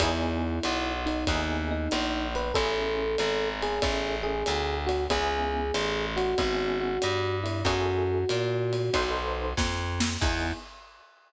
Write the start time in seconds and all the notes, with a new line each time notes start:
0.00 E2 B3 D#4 E4 G#4, kick, ride
0.63 B1, hi-hat pedal, ride
1.06 D#4, ride
1.27 D#2 B3 D#4 E4 G#4, kick, ride
1.71 D#4
1.91 A#1, hi-hat pedal, ride
2.35 B4, ride
2.54 A1 C#4 E4 G#4 A4, kick, ride
3.18 G#1, hi-hat pedal, ride
3.63 G#4, ride
3.82 A1 C#4 E4 G#4 A4, kick, ride
4.23 G#4
4.46 D2, hi-hat pedal, ride
4.87 F#4, ride
5.10 C#2 B3 C#4 E4 G#4, kick, ride
5.74 A1, hi-hat pedal, ride
6.16 F#4, ride
6.38 G#1 B3 C#4 E4 G#4, kick, ride
6.81 F#4
7.02 G2, hi-hat pedal, ride
7.44 E4, ride
7.65 F#2 E4 F#4 G#4 A4, kick, ride
8.29 A#2, hi-hat pedal, ride
8.73 ride
8.93 B1 D#4 A4 B4 C5, kick, ride
9.57 F2, kick, snare
10.00 snare
10.21 E2 B3 D#4 E4 G#4, kick, crash